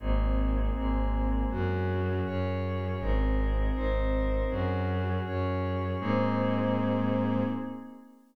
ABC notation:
X:1
M:6/8
L:1/8
Q:3/8=80
K:Abmix
V:1 name="Pad 5 (bowed)"
[B,CEA]3 [A,B,CA]3 | [DGA]3 [DAd]3 | [CEAB]3 [CEBc]3 | [DGA]3 [DAd]3 |
[B,CEA]6 |]
V:2 name="Violin" clef=bass
A,,,3 A,,,3 | G,,3 G,,3 | A,,,3 A,,,3 | G,,3 G,,3 |
A,,6 |]